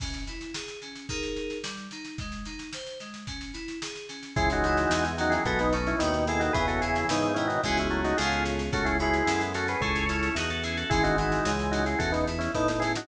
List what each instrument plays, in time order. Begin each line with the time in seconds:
0.00 electric piano 2 C#4, kick, snare, crash
0.14 snare
0.27 electric piano 2 E4, snare
0.41 snare
0.54 electric piano 2 G#4, snare
0.68 snare
0.82 electric piano 2 C#4, snare
0.95 snare
1.09 electric piano 2 D#4 G#4 A#4, kick, snare
1.23 snare
1.36 snare
1.50 snare
1.63 electric piano 2 G3, snare
1.77 snare
1.91 electric piano 2 D#4, snare
2.05 snare
2.18 electric piano 2 G#3, kick, snare
2.32 snare
2.45 electric piano 2 D#4, snare
2.59 snare
2.73 electric piano 2 C5, snare
2.86 snare
3.00 electric piano 2 G#3, snare
3.14 snare
3.27 electric piano 2 C#4, kick, snare
3.41 snare
3.53 electric piano 2 E4, snare
3.68 snare
3.82 electric piano 2 G#4, snare
3.95 snare
4.09 electric piano 2 C#4, snare
4.23 snare
4.36 drawbar organ C#2 E3 G#3 E4 G#4, electric piano 2 C#4, kick, snare
4.50 drawbar organ D#4 F#4, snare
4.64 drawbar organ D#4 F#4, electric piano 2 E4, snare
4.77 snare
4.90 drawbar organ E2, electric piano 2 G#4, snare
5.05 snare
5.18 drawbar organ D#3 F#3 D#4 F#4, electric piano 2 C#4, snare
5.30 drawbar organ E4 G#4, snare
5.45 drawbar organ B1 G#3 B3 F#4 A4, electric piano 2 B3, kick, snare
5.59 drawbar organ B3 D#4, snare
5.72 drawbar organ A3 C#4, electric piano 2 D#4, snare
5.87 drawbar organ C#4 E4, snare
5.99 drawbar organ D#2 B2 D#3 B3 D#4, electric piano 2 F#4, snare
6.12 drawbar organ B3 D#4, snare
6.27 drawbar organ E4 G#4, electric piano 2 A4, snare
6.40 drawbar organ D#4 F#4, snare
6.53 drawbar organ E2 C#3 E3 G#4 B4, electric piano 2 B3, kick, snare
6.68 drawbar organ F#4 A4, snare
6.81 drawbar organ E4 G#4, electric piano 2 E4, snare
6.96 snare
7.09 drawbar organ G#2 B3 D#4, electric piano 2 G#4, snare
7.23 snare
7.34 drawbar organ B2 D#3 C#4 E4, electric piano 2 B3, snare
7.48 drawbar organ D#4 F#4, snare
7.63 drawbar organ C#2 E3 G#3 E4 G#4, electric piano 2 B3 C#4 F#4 G#4, kick, snare
7.77 drawbar organ C#4 E4, snare
7.90 drawbar organ F#3 A3, snare
8.04 drawbar organ D#4 F#4, snare
8.17 drawbar organ C#2 A2 C#3 F4 G#4, electric piano 2 B3 C#4 F4 G#4, snare
8.32 snare
8.45 snare
8.59 snare
8.72 drawbar organ C#2 A3 C#4 F#4 A4, electric piano 2 C#4, kick, snare
8.85 drawbar organ E4 G#4, snare
8.99 drawbar organ G#3 B3 E4 G#4, electric piano 2 F#4, snare
9.14 snare
9.26 drawbar organ F#2, electric piano 2 A4, snare
9.41 snare
9.53 drawbar organ A3 C#4 F#4 A4, electric piano 2 C#4, snare
9.68 drawbar organ G#4 B4, snare
9.81 drawbar organ C#2 E4 G#4 A4 C#5, electric piano 2 C#4, kick, snare
9.95 snare
10.09 drawbar organ C#4 E4, electric piano 2 E4, snare
10.23 snare
10.35 drawbar organ E2 D#4 F#4, electric piano 2 G#4, snare
10.50 drawbar organ F#4 A4, snare
10.63 electric piano 2 C#4, drawbar organ E4 G#4, snare
10.77 drawbar organ F#4 A4, snare
10.90 drawbar organ G#1 E3 G#3 E4 G#4, electric piano 2 C#4, kick, snare
11.03 drawbar organ D#4 F#4, snare
11.18 drawbar organ D#4 F#4, electric piano 2 E4, snare
11.32 snare
11.45 drawbar organ C#2, electric piano 2 G#4, snare
11.59 snare
11.71 electric piano 2 C#4, drawbar organ D#4 F#4, snare
11.86 drawbar organ E4 G#4, snare
11.99 drawbar organ E2 F#4 A4, electric piano 2 C#4, kick, snare
12.12 drawbar organ B3 D#4, snare
12.27 electric piano 2 E4, snare
12.39 drawbar organ C#4 E4, snare
12.54 drawbar organ A2 B3 D#4, electric piano 2 A4, kick, snare
12.68 drawbar organ B3 D#4, snare
12.80 electric piano 2 C#4, drawbar organ E4 G#4, snare
12.95 drawbar organ D#4 F#4, snare